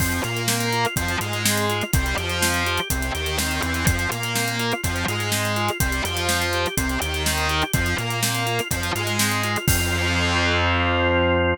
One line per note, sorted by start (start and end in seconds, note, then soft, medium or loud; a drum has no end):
0.00 0.20 F2 medium
0.00 0.21 F3 medium
0.00 0.21 C4 loud
0.00 kick medium
0.00 crash medium
0.12 closed hi-hat medium
0.24 0.86 A#2 medium
0.24 0.86 A#3 medium
0.24 0.46 F4 medium
0.24 closed hi-hat medium
0.37 closed hi-hat medium
0.48 0.70 C4 medium
0.48 snare loud
0.60 closed hi-hat medium
0.73 0.95 F4 medium
0.73 closed hi-hat medium
0.85 closed hi-hat medium
0.96 1.17 F2 medium
0.96 1.17 F3 medium
0.96 1.18 C4 medium
0.96 kick medium
0.96 closed hi-hat medium
1.08 closed hi-hat medium
1.21 1.82 G#2 medium
1.21 1.83 G#3 medium
1.21 1.43 F4 medium
1.21 closed hi-hat medium
1.33 closed hi-hat medium
1.45 1.67 C4 medium
1.45 snare loud
1.57 closed hi-hat medium
1.69 1.91 F4 medium
1.69 closed hi-hat medium
1.81 closed hi-hat medium
1.93 2.14 C2 loud
1.93 2.15 G3 medium
1.93 2.16 C4 loud
1.93 kick loud
1.93 closed hi-hat loud
2.06 closed hi-hat medium
2.17 2.79 F2 medium
2.17 2.80 F3 medium
2.17 2.39 G4 medium
2.17 closed hi-hat medium
2.30 closed hi-hat medium
2.42 2.63 C4 loud
2.42 snare loud
2.54 closed hi-hat medium
2.66 2.88 G4 medium
2.66 closed hi-hat medium
2.78 closed hi-hat medium
2.90 3.11 C2 medium
2.90 3.11 C3 medium
2.90 3.13 C4 medium
2.90 kick medium
2.90 closed hi-hat loud
3.02 closed hi-hat medium
3.15 3.38 D#2 medium
3.15 3.38 D#3 medium
3.15 3.36 G4 medium
3.15 closed hi-hat medium
3.26 closed hi-hat medium
3.39 3.60 D#2 medium
3.39 3.61 D#3 medium
3.39 3.61 C4 medium
3.39 snare medium
3.51 closed hi-hat medium
3.63 3.85 E2 medium
3.63 3.84 E3 medium
3.63 4.09 C4 loud
3.63 closed hi-hat medium
3.74 closed hi-hat medium
3.87 4.07 F2 medium
3.87 4.09 F3 medium
3.87 kick loud
3.87 closed hi-hat loud
3.99 closed hi-hat medium
4.11 4.73 A#2 medium
4.11 4.73 A#3 medium
4.11 4.33 F4 medium
4.11 closed hi-hat medium
4.23 closed hi-hat medium
4.35 4.57 C4 medium
4.35 snare medium
4.48 closed hi-hat medium
4.59 4.81 F4 medium
4.59 closed hi-hat medium
4.72 closed hi-hat medium
4.83 5.05 F2 medium
4.83 5.04 F3 medium
4.83 5.06 C4 medium
4.83 kick medium
4.83 closed hi-hat medium
4.96 closed hi-hat medium
5.08 5.70 G#2 medium
5.08 5.70 G#3 medium
5.08 5.30 F4 medium
5.08 closed hi-hat medium
5.20 closed hi-hat medium
5.32 5.54 C4 medium
5.32 snare medium
5.45 closed hi-hat medium
5.56 5.78 F4 medium
5.56 closed hi-hat medium
5.69 closed hi-hat medium
5.80 6.01 C2 medium
5.80 6.02 G3 medium
5.80 6.02 C4 loud
5.80 kick medium
5.80 closed hi-hat loud
5.92 closed hi-hat medium
6.05 6.66 F2 medium
6.05 6.67 F3 medium
6.05 6.27 G4 medium
6.05 closed hi-hat medium
6.17 closed hi-hat medium
6.28 6.50 C4 medium
6.28 snare medium
6.42 closed hi-hat medium
6.53 6.76 G4 medium
6.53 closed hi-hat medium
6.66 closed hi-hat medium
6.77 6.98 C2 medium
6.77 6.98 C3 medium
6.77 6.99 C4 loud
6.77 kick medium
6.77 closed hi-hat loud
6.90 closed hi-hat medium
7.01 7.64 D#2 medium
7.01 7.63 D#3 medium
7.01 7.23 G4 medium
7.01 closed hi-hat medium
7.14 closed hi-hat medium
7.26 7.48 C4 medium
7.26 snare medium
7.38 closed hi-hat medium
7.49 7.72 G4 medium
7.49 closed hi-hat medium
7.62 closed hi-hat medium
7.73 7.95 F2 loud
7.73 7.96 F3 medium
7.73 7.96 C4 loud
7.73 kick loud
7.73 closed hi-hat medium
7.86 closed hi-hat medium
7.98 8.60 A#2 medium
7.98 8.60 A#3 medium
7.98 8.20 F4 medium
7.98 closed hi-hat medium
8.10 closed hi-hat medium
8.23 8.44 C4 medium
8.23 snare loud
8.23 closed hi-hat medium
8.35 closed hi-hat medium
8.46 8.68 F4 medium
8.46 closed hi-hat medium
8.59 closed hi-hat medium
8.71 8.91 F2 medium
8.71 8.91 F3 medium
8.71 8.94 C4 medium
8.71 kick medium
8.71 closed hi-hat loud
8.83 closed hi-hat medium
8.95 9.57 G#2 medium
8.95 9.57 G#3 medium
8.95 9.17 F4 medium
8.95 closed hi-hat medium
9.07 closed hi-hat medium
9.19 9.42 C4 medium
9.19 snare loud
9.32 closed hi-hat medium
9.44 9.66 F4 medium
9.44 closed hi-hat medium
9.56 closed hi-hat medium
9.67 11.54 F2 loud
9.67 11.54 F3 medium
9.67 11.54 C4 loud
9.67 11.54 F4 loud
9.67 kick loud
9.67 crash loud